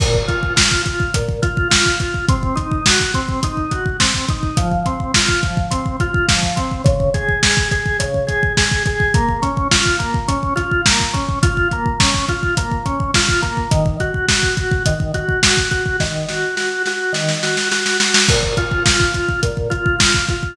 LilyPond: <<
  \new Staff \with { instrumentName = "Drawbar Organ" } { \time 4/4 \key bes \minor \tempo 4 = 105 bes,8 f'8 f'8 f'8 bes,8 f'8 f'8 f'8 | c'8 ees'8 ges'8 c'8 ees'8 ges'8 c'8 ees'8 | f8 c'8 f'8 f8 c'8 f'8 f8 c'8 | des8 aes'8 aes'8 aes'8 des8 aes'8 aes'8 aes'8 |
bes8 des'8 f'8 bes8 des'8 f'8 bes8 des'8 | f'8 bes8 des'8 f'8 bes8 des'8 f'8 bes8 | ees8 ges'8 ges'8 ges'8 ees8 ges'8 ges'8 ges'8 | ees8 ges'8 ges'8 ges'8 ees8 ges'8 ges'8 ges'8 |
bes,8 f'8 f'8 f'8 bes,8 f'8 f'8 f'8 | }
  \new DrumStaff \with { instrumentName = "Drums" } \drummode { \time 4/4 <cymc bd>16 bd16 <hh bd>16 bd16 <bd sn>16 bd16 <hh bd>16 bd16 <hh bd>16 bd16 <hh bd>16 bd16 <bd sn>16 bd16 <hh bd>16 bd16 | <hh bd>16 bd16 <hh bd>16 bd16 <bd sn>16 bd16 <hh bd>16 bd16 <hh bd>16 bd16 <hh bd>16 bd16 <bd sn>16 bd16 <hh bd>16 bd16 | <hh bd>16 bd16 <hh bd>16 bd16 <bd sn>16 bd16 <hh bd>16 bd16 <hh bd>16 bd16 <hh bd>16 bd16 <bd sn>16 bd16 <hh bd>16 bd16 | <hh bd>16 bd16 <hh bd>16 bd16 <bd sn>16 bd16 <hh bd>16 bd16 <hh bd>16 bd16 <hh bd>16 bd16 <bd sn>16 bd16 <hh bd>16 bd16 |
<hh bd>16 bd16 <hh bd>16 bd16 <bd sn>16 bd16 <hh bd>16 bd16 <hh bd>16 bd16 <hh bd>16 bd16 <bd sn>16 bd16 <hh bd>16 bd16 | <hh bd>16 bd16 <hh bd>16 bd16 <bd sn>16 bd16 <hh bd>16 bd16 <hh bd>16 bd16 <hh bd>16 bd16 <bd sn>16 bd16 <hh bd>16 bd16 | <hh bd>16 bd16 <hh bd>16 bd16 <bd sn>16 bd16 <hh bd>16 bd16 <hh bd>16 bd16 <hh bd>16 bd16 <bd sn>16 bd16 <hh bd>16 bd16 | <bd sn>8 sn8 sn8 sn8 sn16 sn16 sn16 sn16 sn16 sn16 sn16 sn16 |
<cymc bd>16 bd16 <hh bd>16 bd16 <bd sn>16 bd16 <hh bd>16 bd16 <hh bd>16 bd16 <hh bd>16 bd16 <bd sn>16 bd16 <hh bd>16 bd16 | }
>>